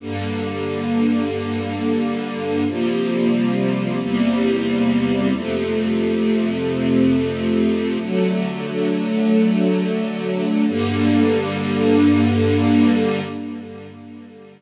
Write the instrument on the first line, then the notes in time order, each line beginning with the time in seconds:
string ensemble 1
0.00 G2 D3 A#3
2.67 C3 F3 G3 A#3
4.00 E2 C3 G3 A#3
5.33 F2 C3 A3
8.00 D3 F#3 A3
10.67 G2 D3 A#3